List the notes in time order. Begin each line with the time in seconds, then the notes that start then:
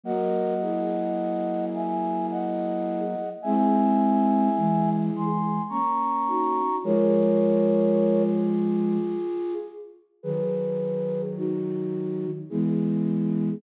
0.04 F#3 A#3 F#4 A#4 D#5 F#5
0.61 E4 G#4
1.75 E5 G#5
2.31 D#5 F#5
3.42 G#3 C4 E4 G#4 E5 G#5
4.57 E3 G#3
5.14 E3 G#3 G#5 C6
5.69 A#3 C#4 A#5 C#6
6.27 D#4 F#4
6.83 F3 G#3 F4 G#4 A#4 C#5
10.23 D#3 F#3 G#4 B4
11.37 D#4 F#4
12.50 E3 G#3 B3 E4 G#4